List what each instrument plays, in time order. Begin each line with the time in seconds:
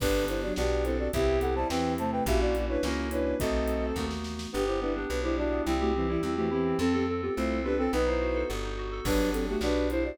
0.00 electric bass (finger) G1, violin D3 B3, electric piano 2 B3 D4 G4, flute D4 B4, kick, crash
0.28 violin D3 B3, flute E4 C5, closed hi-hat
0.42 violin F#3 D4, flute F#4 D5
0.56 electric bass (finger) B1, electric piano 2 B3 D4 G4, violin B3 G4, flute F#4 D5, snare
0.85 violin C4 A4, flute E4 C5, closed hi-hat
0.99 flute F#4 D5
1.13 electric bass (finger) C2, violin B3 G4, electric piano 2 C4 E4 G4, flute G4 E5, kick, closed hi-hat
1.41 violin B3 G4, flute A4 F#5, closed hi-hat
1.55 violin G3 E4, flute C5 A5
1.69 electric bass (finger) E2, violin E3 C4, electric piano 2 C4 E4 G4, flute B4 G5, snare
1.98 violin C3 A3, flute C5 A5, closed hi-hat
2.12 flute B4 G5
2.26 electric bass (finger) A#1, violin A#3 F#4, electric piano 2 A#3 C#4 E4 F#4, flute G4 E5, kick, closed hi-hat
2.41 flute F#4 D5
2.55 violin A#3 F#4, closed hi-hat
2.69 violin D4 B4, flute E4 C#5
2.82 electric bass (finger) C#2, electric piano 2 A#3 C#4 E4 F#4, violin C#4 A#4, flute C#4 A#4, snare
3.11 violin D4 B4, flute E4 C#5, closed hi-hat
3.39 electric bass (finger) B1, electric piano 2 A3 B3 D#4 F#4, violin C4 A4, flute F#4 D#5, kick, closed hi-hat
3.68 closed hi-hat
3.96 electric bass (finger) D#2, electric piano 2 A3 B3 D#4 F#4, kick, snare
4.11 snare
4.24 snare
4.39 snare
4.53 electric bass (finger) G1, electric piano 2 B3, violin B3 G4, flute D4 B4
4.67 flute E4 C5, electric piano 2 G4
4.81 violin G3 E4, electric piano 2 B3, flute D4 B4
4.95 flute B3 G4, violin B3 G4, electric piano 2 D4
5.09 electric bass (finger) B1, electric piano 2 B3, flute D4 B4
5.23 violin G3 E4, flute E4 C5, electric piano 2 G4
5.37 violin G3 E4, electric piano 2 D4, flute F#4 D5
5.52 electric piano 2 B3
5.66 electric bass (finger) C2, flute G3 E4, violin G3 E4, electric piano 2 C4
5.80 flute A3 F#4, electric piano 2 G4
5.94 violin E3 C4, flute G3 E4, electric piano 2 C4
6.08 flute E3 C4, violin G3 E4, electric piano 2 E4
6.23 electric bass (finger) E2, flute G3 E4, electric piano 2 C4
6.36 violin E3 C4, flute A3 F#4, electric piano 2 G4
6.51 violin E3 C4, flute B3 G4, electric piano 2 E4
6.65 electric piano 2 C4
6.79 electric bass (finger) F2, violin C4 A4, flute C4 A4, electric piano 2 C4
6.93 flute B3 G4, electric piano 2 A4
7.08 electric piano 2 C4, flute C4 A4
7.22 flute B3 G4, electric piano 2 F4
7.36 electric bass (finger) C2, flute A3 F4, electric piano 2 C4, violin E4 C5
7.50 electric piano 2 A4
7.64 flute B3 G4, violin D4 B4, electric piano 2 F4
7.77 violin C4 A4, electric piano 2 C4, flute C4 A4
7.92 electric bass (finger) B1, electric piano 2 B3, violin D#4 B4, flute D#4 B4
8.06 electric piano 2 D#4, violin E4 C5
8.21 electric piano 2 F#4
8.35 electric piano 2 A4
8.49 electric bass (finger) G1, electric piano 2 B3
8.63 electric piano 2 D#4
8.78 electric piano 2 F#4
8.92 electric piano 2 A4
9.05 electric bass (finger) G1, violin F#3 D4, electric piano 2 B3 D4 G4, flute D4 B4, kick, crash
9.33 violin F#3 D4, flute C4 A4, closed hi-hat
9.48 violin A3 F#4, flute B3 G4
9.61 electric bass (finger) B1, electric piano 2 B3 D4 G4, violin D4 B4, flute F#4 D5, snare
9.90 violin E4 C5, flute E4 C5, closed hi-hat
10.05 flute F#4 D5